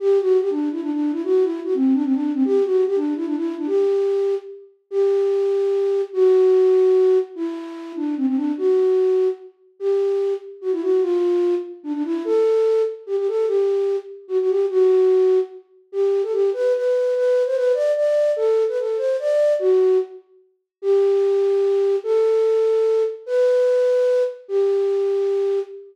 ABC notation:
X:1
M:3/4
L:1/16
Q:1/4=147
K:G
V:1 name="Flute"
G2 F2 G D2 E D D2 E | F2 E2 F C2 D C D2 C | G2 F2 G D2 E D E2 D | G8 z4 |
G12 | F12 | E6 D2 C C D2 | F8 z4 |
G6 z2 F E F2 | =F6 z2 D D E2 | A6 z2 G G A2 | G6 z2 F F G2 |
F8 z4 | G3 A G2 B2 B4 | B3 c B2 d2 d4 | A3 B A2 c2 d4 |
F4 z8 | G12 | A12 | B10 z2 |
G12 |]